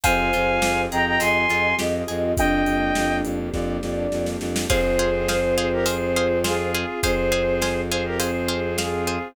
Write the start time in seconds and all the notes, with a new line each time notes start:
0.04 F2 C4 F4 G4 G#4 C5 F5 G#5, kick, closed hi-hat
0.33 F2 F4, closed hi-hat
0.61 F2 G4, snare
0.91 F2 G#4 D#5 G5 A#5, closed hi-hat
1.06 G5 A#5
1.20 F2 C4 G#5 C6, closed hi-hat
1.48 F2 F4, closed hi-hat
1.78 F2 G4 D#5, snare
2.08 F2 G#4, closed hi-hat
2.37 F2 A#3 D4 G4 D#5 G5, kick, closed hi-hat
2.66 F2, closed hi-hat
2.95 F2, snare
3.24 F2, closed hi-hat
3.53 F2 D5, kick, snare
3.82 F2, snare
4.12 F2, snare
4.26 snare
4.40 F2, snare
4.56 snare
4.70 F2 C4 F4 G#4 C5 F5, kick, crash
4.99 G#4 C5 F5
5.28 G#4 C5 F5, snare
5.57 G#4 C5 F5
5.72 G4 A#4
5.86 G#4 C5 F5, closed hi-hat
6.16 G#4 C5 F5
6.44 F4 G#4 C5 F5, snare
6.75 G#4 C5 F5
7.02 F2 C4 G#4 C5 F5, kick, closed hi-hat
7.32 G#4 C5 F5
7.62 G#4 C5 F5, snare
7.91 G#4 C5 F5
8.05 G4 A#4
8.19 G#4 C5 F5, closed hi-hat
8.49 G#4 C5 F5
8.78 F4 G#4 C5 F5, snare
9.07 G#4 C5 F5